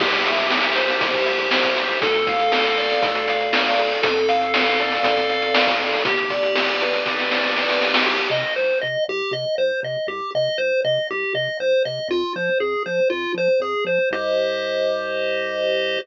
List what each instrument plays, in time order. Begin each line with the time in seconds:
0.00 synth bass 1 C2, lead 1 (square) G4, kick, crash
0.13 closed hi-hat
0.25 lead 1 (square) E5, closed hi-hat
0.38 closed hi-hat
0.50 lead 1 (square) G4, snare
0.63 closed hi-hat
0.76 lead 1 (square) C5, closed hi-hat
0.88 snare, closed hi-hat
1.00 synth bass 1 C2, lead 1 (square) G4, kick, closed hi-hat
1.14 kick, closed hi-hat
1.26 lead 1 (square) E5, closed hi-hat
1.39 closed hi-hat
1.51 lead 1 (square) C5, snare
1.64 kick, closed hi-hat
1.76 lead 1 (square) G4, closed hi-hat
1.89 closed hi-hat
2.02 synth bass 1 D2, lead 1 (square) A4, kick, closed hi-hat
2.14 closed hi-hat
2.27 lead 1 (square) F5, kick, closed hi-hat
2.39 closed hi-hat
2.52 lead 1 (square) A4, snare
2.65 closed hi-hat
2.77 lead 1 (square) D5, closed hi-hat
2.90 snare, closed hi-hat
3.02 synth bass 1 D2, lead 1 (square) A4, kick, closed hi-hat
3.15 closed hi-hat
3.28 lead 1 (square) F5, closed hi-hat
3.40 closed hi-hat
3.53 lead 1 (square) D5, snare
3.66 closed hi-hat
3.78 lead 1 (square) A4, closed hi-hat
3.91 closed hi-hat
4.02 synth bass 1 F2, lead 1 (square) A4, kick, closed hi-hat
4.16 closed hi-hat
4.28 lead 1 (square) F5, closed hi-hat
4.41 closed hi-hat
4.54 lead 1 (square) A4, snare
4.66 closed hi-hat
4.79 lead 1 (square) D5, closed hi-hat
4.91 snare, closed hi-hat
5.03 synth bass 1 F2, lead 1 (square) A4, kick, closed hi-hat
5.17 kick, closed hi-hat
5.29 lead 1 (square) F5, closed hi-hat
5.42 closed hi-hat
5.54 lead 1 (square) D5, snare
5.67 kick, closed hi-hat
5.80 lead 1 (square) A4, closed hi-hat
5.92 open hi-hat
6.05 synth bass 1 G1, lead 1 (square) G4, kick, closed hi-hat
6.18 closed hi-hat
6.30 lead 1 (square) D5, kick, closed hi-hat
6.43 closed hi-hat
6.55 lead 1 (square) G4, snare
6.68 closed hi-hat
6.81 lead 1 (square) B4, closed hi-hat
6.93 snare, closed hi-hat
7.05 synth bass 1 G1, lead 1 (square) G4, kick, snare
7.18 snare
7.31 lead 1 (square) D5, snare
7.44 snare
7.56 lead 1 (square) B4, snare
7.69 snare
7.82 lead 1 (square) G4, snare
7.94 snare
8.06 synth bass 1 C2, lead 1 (square) G4
8.30 synth bass 1 C3, lead 1 (square) D#5
8.56 synth bass 1 C2, lead 1 (square) C5
8.81 synth bass 1 C3, lead 1 (square) D#5
9.08 synth bass 1 C2, lead 1 (square) G4
9.31 synth bass 1 C3, lead 1 (square) D#5
9.58 synth bass 1 C2, lead 1 (square) C5
9.83 synth bass 1 C3, lead 1 (square) D#5
10.07 synth bass 1 C2, lead 1 (square) G4
10.35 synth bass 1 C3, lead 1 (square) D#5
10.58 synth bass 1 C2, lead 1 (square) C5
10.84 synth bass 1 C3, lead 1 (square) D#5
11.10 synth bass 1 C2, lead 1 (square) G4
11.34 synth bass 1 C3, lead 1 (square) D#5
11.60 synth bass 1 C2, lead 1 (square) C5
11.85 synth bass 1 C3, lead 1 (square) D#5
12.09 synth bass 1 F2, lead 1 (square) F4
12.36 synth bass 1 F3, lead 1 (square) C5
12.60 synth bass 1 F2, lead 1 (square) G#4
12.86 synth bass 1 F3, lead 1 (square) C5
13.10 synth bass 1 F2, lead 1 (square) F4
13.34 synth bass 1 F3, lead 1 (square) C5
13.60 synth bass 1 F2, lead 1 (square) G#4
13.85 synth bass 1 F3, lead 1 (square) C5
14.11 synth bass 1 C2, lead 1 (square) G4 C5 D#5